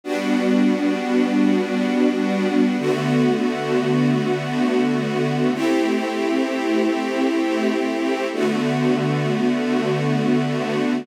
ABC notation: X:1
M:4/4
L:1/8
Q:1/4=87
K:Ador
V:1 name="String Ensemble 1"
[G,B,DF]8 | [D,A,B,F]8 | [A,CEG]8 | [D,A,B,F]8 |]